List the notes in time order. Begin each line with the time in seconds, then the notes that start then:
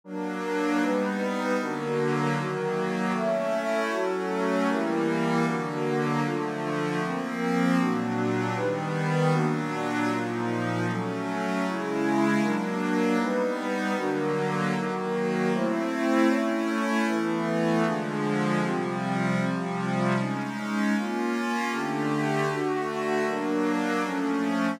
0.04 F#3 A#3 D4 A#4
0.80 G3 B3 D#4 B4
1.59 D3 F#3 A#3 D4 F#4 A#4
2.35 D#3 F#3 A#3 D#4 F#4 A#4
3.13 A3 C#4 E4 A4 C#5 E5
3.89 F#3 A3 C#4 F#4 A4 C#5
4.68 E3 G3 A#3 E4 G4 A#4
5.46 D3 F#3 A#3 D4 F#4 A#4
6.23 D3 F3 A3 D4 F4 A4
7.00 F3 A#3 C4 A#4
7.78 A#2 F#3 A#3 D4 F#4
8.55 D#3 G3 B3 D#4 G4 B4
9.31 A#2 F#3 A#3 D4 F#4
10.08 A#2 F3 A#3 D#4 F4
10.87 F#3 A3 C#4 A4
11.64 C#3 G#3 C#4 E4 G#4
12.42 F#3 A#3 D4 A#4
13.18 G3 B3 D#4 B4
13.96 D3 F#3 A#3 D4 F#4 A#4
14.75 D#3 F#3 A#3 D#4 F#4 A#4
15.53 A3 C4 E4 C5
16.28 A3 C#4 E4 C#5
17.06 E3 A3 B3 E4 A4 B4
17.84 D3 F3 G#3 D4 F4 G#4
18.62 C3 F3 G3 C4 F4 G4
19.38 C3 F3 G3 C4 F4 G4
20.16 G#3 C#4 D#4
20.93 A#3 C#4 F4
21.70 D3 A3 D4 G4 A4
22.48 D3 A3 D4 F#4 A4
23.26 F#3 A#3 D4 A#4
24.03 F3 A3 C#4 A4